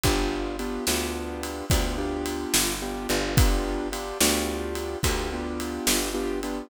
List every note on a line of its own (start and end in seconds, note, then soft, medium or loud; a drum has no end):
0.03 0.79 G1 loud
0.03 0.56 B3 medium
0.03 0.56 D4 medium
0.03 0.56 F4 medium
0.03 0.56 G4 medium
0.03 kick medium
0.03 ride medium
0.59 0.85 B3 medium
0.59 0.85 D4 medium
0.59 0.85 F4 medium
0.59 0.85 G4 medium
0.59 ride medium
0.87 1.63 D2 medium
0.87 1.65 B3 medium
0.87 1.65 D4 medium
0.87 1.65 F4 medium
0.87 1.65 G4 medium
0.87 snare medium
1.43 ride medium
1.70 2.46 D2 medium
1.70 1.96 B3 medium
1.70 1.96 D4 medium
1.70 1.96 F4 medium
1.70 1.96 G4 medium
1.70 kick medium
1.70 ride loud
1.98 2.75 B3 medium
1.98 2.75 D4 medium
1.98 2.75 F4 medium
1.98 2.75 G4 medium
2.26 ride medium
2.54 3.07 G1 medium
2.54 snare loud
2.82 3.08 B3 medium
2.82 3.08 D4 medium
2.82 3.08 F4 medium
2.82 3.08 G4 medium
3.09 4.13 G1 loud
3.09 3.35 B3 medium
3.09 3.35 D4 medium
3.09 3.35 F4 medium
3.09 3.35 G4 medium
3.09 ride medium
3.37 3.88 B3 medium
3.37 3.88 D4 loud
3.37 3.88 F4 loud
3.37 3.88 G4 medium
3.37 kick loud
3.37 ride loud
3.92 4.18 B3 medium
3.92 4.18 D4 medium
3.92 4.18 F4 medium
3.92 4.18 G4 medium
3.92 ride medium
4.20 4.96 D2 loud
4.20 4.98 B3 medium
4.20 4.98 D4 medium
4.20 4.98 F4 medium
4.20 4.98 G4 medium
4.20 snare loud
4.75 ride medium
5.03 5.79 D2 loud
5.03 5.29 B3 medium
5.03 5.29 D4 medium
5.03 5.29 F4 medium
5.03 5.29 G4 medium
5.03 kick medium
5.03 ride medium
5.32 6.09 B3 medium
5.32 6.09 D4 medium
5.32 6.09 F4 medium
5.32 6.09 G4 medium
5.60 ride medium
5.87 6.62 G1 medium
5.87 snare loud
6.14 6.40 B3 medium
6.14 6.40 D4 medium
6.14 6.40 F4 medium
6.14 6.40 G4 loud
6.43 6.69 B3 medium
6.43 6.69 D4 medium
6.43 6.69 F4 medium
6.43 6.69 G4 medium
6.43 ride medium